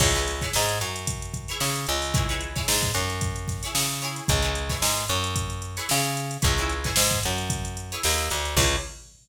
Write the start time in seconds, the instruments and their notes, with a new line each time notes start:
0.00 electric bass (finger) C#2, acoustic guitar (steel) E4 G#4 B4 C#5, kick, crash
0.15 acoustic guitar (steel) E4 G#4 B4 C#5, closed hi-hat
0.27 snare, closed hi-hat
0.41 acoustic guitar (steel) E4 G#4 B4 C#5, kick, snare, closed hi-hat
0.53 electric bass (finger) G#2, snare
0.69 closed hi-hat
0.81 electric bass (finger) F#2, closed hi-hat
0.96 closed hi-hat
1.07 kick, closed hi-hat
1.22 closed hi-hat
1.34 kick, closed hi-hat
1.48 acoustic guitar (steel) E4 G#4 B4 C#5, closed hi-hat
1.60 electric bass (finger) C#3, snare
1.76 closed hi-hat
1.87 electric bass (finger) C#2, snare, closed hi-hat
2.02 open hi-hat
2.14 acoustic guitar (steel) E4 G#4 B4 C#5, kick, closed hi-hat
2.29 acoustic guitar (steel) E4 G#4 B4 C#5, closed hi-hat
2.41 closed hi-hat
2.56 acoustic guitar (steel) E4 G#4 B4 C#5, kick, snare, closed hi-hat
2.68 electric bass (finger) G#2, snare
2.83 kick, closed hi-hat
2.94 electric bass (finger) F#2, snare, closed hi-hat
3.10 closed hi-hat
3.21 kick, closed hi-hat
3.36 closed hi-hat
3.48 kick, snare, closed hi-hat
3.63 acoustic guitar (steel) E4 G#4 B4 C#5, snare, closed hi-hat
3.75 electric bass (finger) C#3, snare
3.89 closed hi-hat
4.02 acoustic guitar (steel) E4 G#4 B4 C#5, closed hi-hat
4.16 closed hi-hat
4.28 electric bass (finger) C#2, kick, closed hi-hat
4.42 acoustic guitar (steel) E4 G#4 B4 C#5, closed hi-hat
4.55 closed hi-hat
4.69 acoustic guitar (steel) E4 G#4 B4 C#5, kick, snare, closed hi-hat
4.82 electric bass (finger) G#2, snare
4.97 closed hi-hat
5.08 electric bass (finger) F#2, closed hi-hat
5.24 closed hi-hat
5.36 kick, closed hi-hat
5.50 closed hi-hat
5.62 closed hi-hat
5.77 acoustic guitar (steel) E4 G#4 B4 C#5, snare, closed hi-hat
5.89 electric bass (finger) C#3, snare
6.04 closed hi-hat
6.17 closed hi-hat
6.31 closed hi-hat
6.42 electric bass (finger) C#2, acoustic guitar (steel) E4 G#4 B4 C#5, kick, closed hi-hat
6.57 acoustic guitar (steel) E4 G#4 B4 C#5, closed hi-hat
6.70 closed hi-hat
6.84 acoustic guitar (steel) E4 G#4 B4 C#5, kick, snare, closed hi-hat
6.96 electric bass (finger) G#2, snare
7.11 kick, closed hi-hat
7.23 electric bass (finger) F#2, closed hi-hat
7.38 closed hi-hat
7.50 kick, closed hi-hat
7.65 closed hi-hat
7.77 closed hi-hat
7.92 acoustic guitar (steel) E4 G#4 B4 C#5, closed hi-hat
8.03 electric bass (finger) D#2, snare
8.18 closed hi-hat
8.30 electric bass (finger) D2, closed hi-hat
8.45 snare, closed hi-hat
8.57 electric bass (finger) C#2, acoustic guitar (steel) E4 G#4 B4 C#5, kick, crash